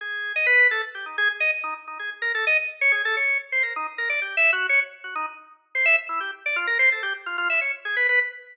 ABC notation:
X:1
M:5/8
L:1/16
Q:1/4=128
K:none
V:1 name="Drawbar Organ"
^G3 ^d B2 A z =G ^D | ^G z ^d z ^D z D G z ^A | A ^d z2 ^c ^G A c2 z | c ^A ^D z A =d (3G2 e2 ^F2 |
^c z2 ^F ^D z4 =c | e z E G z d F ^A c =A | G z F F e ^c z ^G B B |]